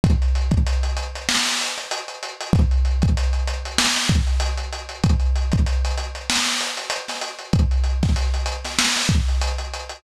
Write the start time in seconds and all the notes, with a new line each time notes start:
0.04 kick, closed hi-hat
0.22 closed hi-hat
0.35 closed hi-hat
0.51 kick, closed hi-hat
0.67 closed hi-hat
0.83 closed hi-hat
0.97 closed hi-hat
1.15 closed hi-hat
1.29 snare
1.46 snare, closed hi-hat
1.61 closed hi-hat
1.78 closed hi-hat
1.91 closed hi-hat
2.08 closed hi-hat
2.23 closed hi-hat
2.41 closed hi-hat
2.53 kick, closed hi-hat
2.71 closed hi-hat
2.85 closed hi-hat
3.02 kick, closed hi-hat
3.17 closed hi-hat
3.33 closed hi-hat
3.48 closed hi-hat
3.65 closed hi-hat
3.78 snare
3.96 snare, closed hi-hat
4.09 kick, closed hi-hat
4.27 closed hi-hat
4.40 closed hi-hat
4.58 closed hi-hat
4.73 closed hi-hat
4.89 closed hi-hat
5.04 kick, closed hi-hat
5.20 closed hi-hat
5.36 closed hi-hat
5.52 kick, closed hi-hat
5.66 closed hi-hat
5.85 closed hi-hat
5.98 closed hi-hat
6.15 closed hi-hat
6.30 snare
6.46 snare, closed hi-hat
6.61 closed hi-hat
6.77 closed hi-hat
6.90 closed hi-hat
7.08 snare, closed hi-hat
7.21 closed hi-hat
7.39 closed hi-hat
7.53 kick, closed hi-hat
7.71 closed hi-hat
7.84 closed hi-hat
8.03 kick, snare, closed hi-hat
8.16 closed hi-hat
8.34 closed hi-hat
8.46 closed hi-hat
8.65 snare, closed hi-hat
8.79 snare
8.96 snare, closed hi-hat
9.09 kick, closed hi-hat
9.28 closed hi-hat
9.42 closed hi-hat
9.58 closed hi-hat
9.74 closed hi-hat
9.89 closed hi-hat